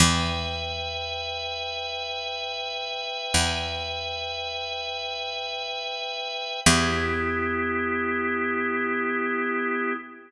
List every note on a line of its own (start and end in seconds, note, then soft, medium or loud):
0.00 3.07 E2 loud
0.00 6.60 B4 medium
0.00 6.60 E5 medium
0.00 6.60 G5 medium
3.34 6.41 E2 medium
6.66 9.93 E2 loud
6.66 9.93 B3 loud
6.66 9.93 E4 loud
6.66 9.93 G4 loud